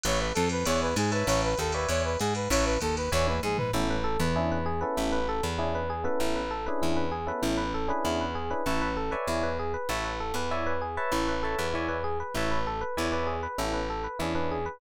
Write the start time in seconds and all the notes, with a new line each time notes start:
0.04 A1 B4 C#5 E5 A5, ride
0.19 B4
0.34 F2 A4, hi-hat pedal, ride
0.49 B4, ride
0.66 E2 C#5 D5 E5 G#5, ride
0.81 B4
0.96 G#2 G#4, hi-hat pedal, ride
1.12 B4 C#5 E5 A5, ride
1.27 A1 C#5, ride
1.44 B4
1.58 D#2 A4, kick, hi-hat pedal, ride
1.72 B4 C#5 D5 E5 G#5, ride
1.89 E2 C#5, ride
2.05 B4
2.19 G#2 G#4, hi-hat pedal, ride
2.35 B4, ride
2.50 A1 B4 C#5 E5 A5, kick, ride
2.65 B4
2.80 D#2 A4, kick, hi-hat pedal, ride
2.97 B4, ride
3.12 E2 C#5 D5 E5 G#5, kick, snare
3.27 B4, high tom
3.43 G#2 G#4, mid tom
3.58 B4, floor tom
3.73 A1 B3 C#4 E4 A4
3.90 B4
4.04 A4
4.20 E2 B4
4.36 C#4 D4 E4 G#4
4.52 B4
4.66 G#4
4.81 B3 C#4 E4 A4 B4
4.97 A1 E4
5.12 B4
5.29 A4
5.43 E2 B4
5.58 C#4 D4 E4 G#4
5.75 B4
5.90 G#4
6.04 B3 C#4 E4 A4 B4
6.20 A1 E4
6.36 B4
6.51 A4
6.66 C#4 D4 E4 G#4 B4
6.82 E2 E4
6.97 B4
7.12 G#4
7.27 B3 C#4 E4 A4 B4
7.42 A1 E4
7.57 B4
7.74 A4
7.88 C#4 D4 E4 G#4 B4
8.05 E2 E4
8.21 B4
8.35 G#4
8.51 C#4 D4 E4 G#4 B4
8.66 A1 E4 B4 C#5 E5 A5
8.82 B4
8.97 A4
9.11 B4 C#5 D5 E5 G#5
9.27 E2 E4
9.43 B4
9.59 G#4
9.74 B4
9.89 A1 E4 B4 C#5 E5 A5
10.05 B4
10.20 A4
10.34 E2 B4
10.51 E4 C#5 D5 E5 G#5
10.67 B4
10.81 G#4
10.97 B4 C#5 E5 A5
11.12 A1 E4
11.28 B4
11.43 A4 B4 C#5 E5 A5
11.58 E2 B4
11.74 E4 C#5 D5 E5 G#5
11.89 B4
12.04 G#4
12.20 B4
12.34 A1 E4 B4 C#5 E5 A5
12.51 B4
12.67 A4
12.81 B4
12.97 E2 E4 C#5 D5 E5 G#5
13.12 B4 C#5 D5 E5 G#5
13.27 G#4
13.43 B4
13.58 A1 B3 C#4 E4 A4
13.73 B4
13.90 A4
14.04 B4
14.19 E2 C#4 D4 E4 G#4
14.35 C#4 D4 E4 G#4 B4
14.51 G#4
14.66 B4